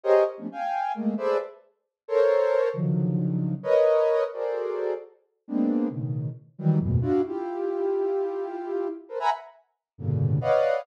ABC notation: X:1
M:4/4
L:1/16
Q:1/4=133
K:none
V:1 name="Ocarina"
[G_A_Bc_d_e]2 z [F,G,=A,=B,_D=D] [fg_a]4 [_A,=A,_B,]2 [_A=A=Bc=d=e]2 z4 | z2 [A_Bc_d]6 [_D,=D,_E,F,_G,]8 | [_B=B_d_e]6 [_G_A=A_Bc=d]6 z4 | [_A,_B,=B,CD]4 [=A,,B,,_D,_E,]4 z2 [E,=E,_G,=G,]2 [E,,_G,,_A,,=A,,_B,,=B,,]2 [=DEF_G]2 |
[EFG]16 | [A_B=Bc] [e_g_a_b=b] z6 [=G,,=A,,_B,,=B,,_D,=D,]4 [B_d=d_ef_g]4 |]